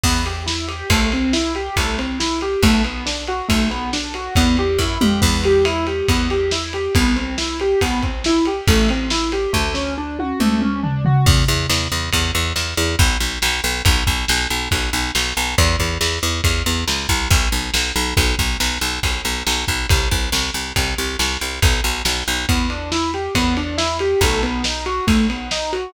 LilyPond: <<
  \new Staff \with { instrumentName = "Acoustic Grand Piano" } { \time 2/4 \key e \minor \tempo 4 = 139 b8 g'8 e'8 g'8 | \time 4/4 a8 c'8 e'8 g'8 a8 c'8 e'8 g'8 | a8 b8 d'8 fis'8 a8 b8 d'8 fis'8 | \time 2/4 b8 g'8 e'8 g'8 |
\time 4/4 b8 g'8 e'8 g'8 b8 g'8 e'8 g'8 | b8 c'8 e'8 g'8 b8 c'8 e'8 g'8 | \time 2/4 a8 c'8 e'8 g'8 | \time 4/4 a8 cis'8 d'8 fis'8 a8 cis'8 d'8 fis'8 |
r1 | \time 2/4 r2 | \time 4/4 r1 | r1 |
\time 2/4 r2 | \time 4/4 r1 | r1 | \time 2/4 r2 |
\time 4/4 b8 d'8 e'8 g'8 b8 d'8 e'8 g'8 | a8 b8 dis'8 fis'8 a8 b8 dis'8 fis'8 | }
  \new Staff \with { instrumentName = "Electric Bass (finger)" } { \clef bass \time 2/4 \key e \minor e,2 | \time 4/4 c,2 c,2 | b,,2 b,,2 | \time 2/4 e,4 fis,8 f,8 |
\time 4/4 e,2 e,2 | c,2 c,2 | \time 2/4 a,,2 | \time 4/4 d,2 d,2 |
e,8 e,8 e,8 e,8 e,8 e,8 e,8 e,8 | \time 2/4 b,,8 b,,8 b,,8 b,,8 | \time 4/4 b,,8 b,,8 b,,8 b,,8 b,,8 b,,8 b,,8 b,,8 | e,8 e,8 e,8 e,8 e,8 e,8 cis,8 c,8 |
\time 2/4 b,,8 b,,8 b,,8 b,,8 | \time 4/4 b,,8 b,,8 b,,8 b,,8 b,,8 b,,8 b,,8 b,,8 | c,8 c,8 c,8 c,8 c,8 c,8 c,8 c,8 | \time 2/4 b,,8 b,,8 b,,8 b,,8 |
\time 4/4 e,2 e,2 | b,,2 b,,2 | }
  \new DrumStaff \with { instrumentName = "Drums" } \drummode { \time 2/4 <cymc bd>8 cymr8 sn8 cymr8 | \time 4/4 <bd cymr>8 cymr8 sn8 cymr8 <bd cymr>8 cymr8 sn8 cymr8 | <bd cymr>8 cymr8 sn8 cymr8 <bd cymr>8 cymr8 sn8 cymr8 | \time 2/4 <bd cymr>8 cymr8 <bd sn>8 toml8 |
\time 4/4 <cymc bd>8 cymr8 cymr8 cymr8 <bd cymr>8 cymr8 sn8 cymr8 | <bd cymr>8 cymr8 sn8 cymr8 <bd cymr>8 <bd cymr>8 sn8 cymr8 | \time 2/4 <bd cymr>8 cymr8 sn8 cymr8 | \time 4/4 <bd sn>8 sn8 r8 tommh8 toml8 toml8 tomfh8 tomfh8 |
<cymc bd>8 bd8 sn4 <bd cymr>4 sn4 | \time 2/4 <bd cymr>4 sn4 | \time 4/4 <bd cymr>8 bd8 sn4 <bd cymr>4 sn4 | <bd cymr>8 bd8 sn4 <bd cymr>4 sn8 bd8 |
\time 2/4 <bd cymr>4 sn4 | \time 4/4 <bd cymr>8 bd8 sn4 <bd cymr>4 sn8 bd8 | <bd cymr>8 bd8 sn4 <bd cymr>4 sn4 | \time 2/4 <bd cymr>4 sn4 |
\time 4/4 <bd cymr>8 cymr8 sn8 cymr8 <bd cymr>8 cymr8 sn8 cymr8 | <bd cymr>8 cymr8 sn8 cymr8 <bd cymr>8 cymr8 sn8 cymr8 | }
>>